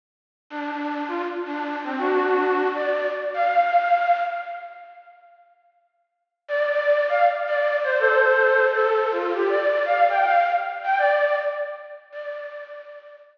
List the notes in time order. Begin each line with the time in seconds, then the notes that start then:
0.50 D4
0.71 D4
1.08 F4
1.45 D4
1.84 C4
1.98 D4 F#4
2.75 D5
3.34 F5
6.48 D5
6.70 D5
7.09 F5
7.47 D5
7.83 C5
7.99 A4 C5
8.74 A4
9.11 F4
9.33 G4
9.49 D5
9.85 F5
10.09 G5
10.25 F5
10.84 G5
10.98 D5
12.12 D5